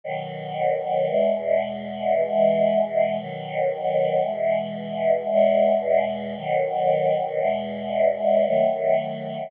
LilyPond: \new Staff { \time 4/4 \key e \major \partial 4 \tempo 4 = 57 <b, dis fis>4 | <e, b, gis>4 <b, e gis>4 <b, dis fis>4 <b, e gis>4 | <e, b, gis>4 <b, dis fis>4 <e, b, gis>4 <dis fis a>4 | }